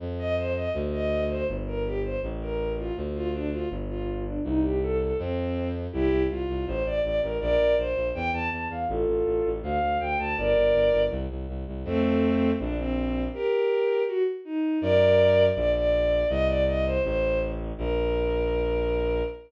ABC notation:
X:1
M:2/2
L:1/8
Q:1/2=81
K:Bb
V:1 name="Violin"
z e c e z e2 c | z B G c z B2 F | z F D F z F2 D | E G A A C3 z |
[K:F] [EG]2 F2 c d d B | [Bd]2 c2 g a a f | [FA]4 f2 g a | [Bd]4 z4 |
[K:Bb] [A,C]4 D C3 | [GB]4 _G z E2 | [Bd]4 d d3 | e d e c c2 z2 |
B8 |]
V:2 name="Violin" clef=bass
F,,4 D,,4 | G,,,4 A,,,4 | D,,4 G,,,4 | C,,4 F,,4 |
[K:F] C,, C,, C,, C,, A,,, A,,, A,,, A,,, | B,,, B,,, B,,, B,,, E,, E,, E,, E,, | A,,, A,,, A,,, A,,, D,, D,, D,, D,, | G,,, G,,, G,,, G,,, C,, C,, C,, C,, |
[K:Bb] F,,4 B,,,4 | z8 | ^F,,4 B,,,4 | C,,4 A,,,4 |
B,,,8 |]